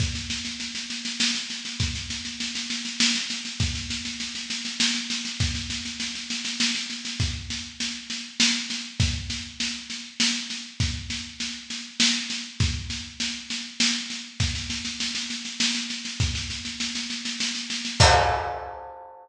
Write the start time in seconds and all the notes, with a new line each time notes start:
0.00 kick, snare
0.15 snare
0.30 snare
0.45 snare
0.60 snare
0.75 snare
0.90 snare
1.05 snare
1.20 snare
1.35 snare
1.50 snare
1.65 snare
1.80 kick, snare
1.95 snare
2.10 snare
2.25 snare
2.40 snare
2.55 snare
2.70 snare
2.85 snare
3.00 snare
3.15 snare
3.30 snare
3.45 snare
3.60 kick, snare
3.75 snare
3.90 snare
4.05 snare
4.20 snare
4.35 snare
4.50 snare
4.65 snare
4.80 snare
4.95 snare
5.10 snare
5.25 snare
5.40 kick, snare
5.55 snare
5.70 snare
5.85 snare
6.00 snare
6.15 snare
6.30 snare
6.45 snare
6.60 snare
6.75 snare
6.90 snare
7.05 snare
7.20 kick, snare
7.50 snare
7.80 snare
8.10 snare
8.40 snare
8.70 snare
9.00 kick, snare
9.30 snare
9.60 snare
9.90 snare
10.20 snare
10.50 snare
10.80 kick, snare
11.10 snare
11.40 snare
11.70 snare
12.00 snare
12.30 snare
12.60 kick, snare
12.90 snare
13.20 snare
13.50 snare
13.80 snare
14.10 snare
14.40 kick, snare
14.55 snare
14.70 snare
14.85 snare
15.00 snare
15.15 snare
15.30 snare
15.45 snare
15.60 snare
15.75 snare
15.90 snare
16.05 snare
16.20 kick, snare
16.35 snare
16.50 snare
16.65 snare
16.80 snare
16.95 snare
17.10 snare
17.25 snare
17.40 snare
17.55 snare
17.70 snare
17.85 snare
18.00 kick, crash